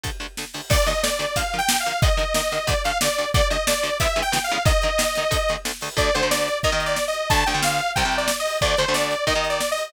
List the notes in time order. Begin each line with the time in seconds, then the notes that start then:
0.04 D2 D3 A3, kick, closed hi-hat
0.20 D2 D3 A3, closed hi-hat
0.37 D2 D3 A3, snare
0.54 D2 D3 A3, open hi-hat
0.70 D2 D3 A3 D5, kick, crash
0.86 D2 D3 A3 D#5, closed hi-hat
1.03 D2 D3 A3 D5, snare
1.19 D2 D3 A3, snare, closed hi-hat
1.36 D3 F3 A#3 F5, kick, closed hi-hat
1.53 D3 F3 A#3, closed hi-hat
1.58 G5
1.69 D3 F3 A#3, snare
1.80 F5
1.86 D3 F3 A#3, closed hi-hat
2.02 D3 D#3 A#3 D#5, kick, closed hi-hat
2.17 D3 D#3 A#3, closed hi-hat
2.34 D3 D#3 A#3 D#5, snare
2.52 D3 D#3 A#3, snare, closed hi-hat
2.67 D2 D3 A3 D5, kick, closed hi-hat
2.84 D2 D3 A3 F5, closed hi-hat
3.01 D2 D3 A3 D5, snare
3.18 D2 D3 A3, closed hi-hat
3.34 D2 D3 A3 D5, kick, closed hi-hat
3.50 D2 D3 A3 D#5, closed hi-hat
3.67 D2 D3 A3 D5, snare
3.83 D2 D3 A3, snare, closed hi-hat
4.00 D2 C#3 E3 G#3 B3 E5, kick, closed hi-hat
4.16 D2 C#3 E3 G#3 B3, closed hi-hat
4.22 G5
4.32 D2 C#3 E3 G#3 B3, snare
4.44 F5
4.49 D2 C#3 E3 G#3 B3, closed hi-hat
4.65 D3 D#3 A#3 D#5, kick, closed hi-hat
4.82 D3 D#3 A#3, closed hi-hat
4.98 D3 D#3 A#3, snare
5.15 D3 D#3 A#3, snare, closed hi-hat
5.31 D2 D3 A3, kick, closed hi-hat
5.49 D2 D3 A3, closed hi-hat
5.65 D2 D3 A3, snare
5.81 D2 D3 A3, open hi-hat
5.97 D2 D3 A3 D5, kick, closed hi-hat
6.14 D2 D3 A3 C5, closed hi-hat
6.22 D2 D3 A3
6.31 D5, snare
6.48 closed hi-hat
6.63 D#2 D#3 A#3 D#5, kick, closed hi-hat
6.72 D#2 D#3 A#3
6.80 closed hi-hat
6.86 D5
6.96 snare
7.08 D#5
7.13 closed hi-hat
7.30 D2 D3 A3 A5, kick, closed hi-hat
7.46 D2 D3 A3 G5, closed hi-hat
7.54 D2 D3 A3
7.63 F5, snare
7.79 closed hi-hat
7.96 C2 C3 G3 G5, kick, closed hi-hat
8.05 C2 C3 G3
8.12 closed hi-hat
8.18 D5
8.28 snare
8.40 D#5
8.46 open hi-hat
8.61 D2 D3 A3 D5, kick, closed hi-hat
8.77 D2 D3 A3 C5, closed hi-hat
8.88 D2 D3 A3
8.94 D5, snare
9.11 closed hi-hat
9.27 D#2 D#3 A#3 D#5, kick, closed hi-hat
9.35 D#2 D#3 A#3
9.44 closed hi-hat
9.49 D5
9.61 snare
9.71 D#5
9.77 open hi-hat